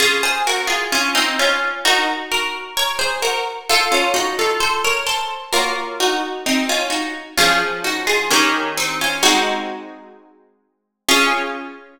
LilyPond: <<
  \new Staff \with { instrumentName = "Acoustic Guitar (steel)" } { \time 4/4 \key des \major \tempo 4 = 65 <f' aes'>16 <aes' c''>16 <ges' bes'>16 <f' aes'>16 <des' f'>16 <c' ees'>16 <des' f'>8 <ees' ges'>16 r16 <ges' bes'>8 <bes' des''>16 <aes' c''>16 <ges' bes'>16 r16 | <f' a'>16 <des' f'>16 <ees' ges'>16 <f' a'>16 <a' c''>16 <bes' des''>16 <a' c''>8 <ges' bes'>16 r16 <ees' ges'>8 <c' ees'>16 <des' f'>16 <ees' ges'>16 r16 | <des' f'>8 <ees' ges'>16 <f' aes'>16 <bes des'>8 <c' ees'>16 <des' f'>16 <ees' ges'>4. r8 | des'1 | }
  \new Staff \with { instrumentName = "Acoustic Guitar (steel)" } { \time 4/4 \key des \major <des' f'>2 <ees' ges' bes'>2 | <f' a' c''>2 <bes f' des''>2 | <f des' aes'>4 <ees des' g' bes'>4 <aes c' ges'>2 | <f' aes'>1 | }
>>